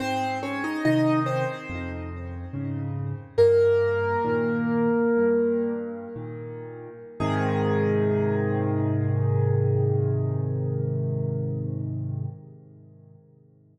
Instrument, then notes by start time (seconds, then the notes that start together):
acoustic grand piano
0.00 G#2 C4 C5
0.43 C#4 C#5
0.64 D#4 D#5
0.85 C3 D#3 D#4 D#5
1.26 C4 C5
1.69 F2
2.53 G#2 C#3
3.38 G2 A#3 A#4
4.25 A#2 D#3
5.17 G2
6.15 A#2 D#3
7.20 G#2 C3 D#3 G#4